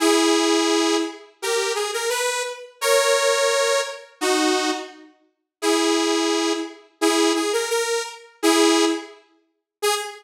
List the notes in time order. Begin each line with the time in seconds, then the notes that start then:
0.00 E4 G#4
1.42 G4 A#4
1.75 G#4
1.93 A#4
2.09 B4
2.81 A#4 C#5
4.21 D#4 F#4
5.62 E4 G#4
7.01 E4 G#4
7.35 G#4
7.53 A#4
7.70 A#4
8.43 E4 G#4
9.82 G#4